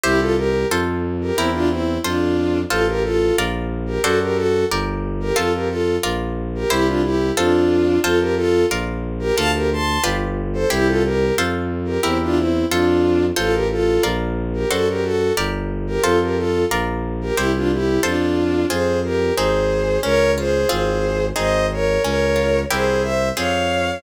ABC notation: X:1
M:2/4
L:1/16
Q:1/4=90
K:F
V:1 name="Violin"
[EG] [FA] [GB]2 z3 [GB] | [CE] [DF] [CE]2 [DF]4 | [FA] [GB] [FA]2 z3 [GB] | [^FA] [GB] [FA]2 z3 [GB] |
[FA] [GB] [FA]2 z3 [GB] | [EG] [DF] [EG]2 [DF]4 | [FA] [GB] [FA]2 z3 [GB] | [fa] [GB] [ac']2 z3 [Ac] |
[EG] [FA] [GB]2 z3 [GB] | [CE] [DF] [CE]2 [DF]4 | [FA] [GB] [FA]2 z3 [GB] | [^FA] [GB] [FA]2 z3 [GB] |
[FA] [GB] [FA]2 z3 [GB] | [EG] [DF] [EG]2 [DF]4 | [K:Fm] [Ac]2 [GB]2 [Ac]4 | [Bd]2 [Ac]2 [Ac]4 |
[ce]2 [Bd]2 [Bd]4 | [Ac]2 [c=e]2 [df]4 |]
V:2 name="Orchestral Harp"
[EGc]4 [FAc]4 | [EGB]4 [FAc]4 | [FAc]4 [FBd]4 | [^FAcd]4 [GBd]4 |
[FAc]4 [FBd]4 | [EGc]4 [FAc]4 | [FAc]4 [FBd]4 | [FAd]4 [FG=Bd]4 |
[EGc]4 [FAc]4 | [EGB]4 [FAc]4 | [FAc]4 [FBd]4 | [^FAcd]4 [GBd]4 |
[FAc]4 [FBd]4 | [EGc]4 [FAc]4 | [K:Fm] [CFA]4 [CEA]4 | D2 F2 [CFA]4 |
[CEA]4 D2 F2 | [C=EGB]4 [CFA]4 |]
V:3 name="Violin" clef=bass
C,,4 F,,4 | E,,4 F,,4 | A,,,4 B,,,4 | ^F,,4 G,,,4 |
F,,4 B,,,4 | C,,4 F,,4 | F,,4 B,,,4 | D,,4 G,,,4 |
C,,4 F,,4 | E,,4 F,,4 | A,,,4 B,,,4 | ^F,,4 G,,,4 |
F,,4 B,,,4 | C,,4 F,,4 | [K:Fm] F,,4 A,,,4 | D,,4 A,,,4 |
A,,,4 D,,4 | C,,4 F,,4 |]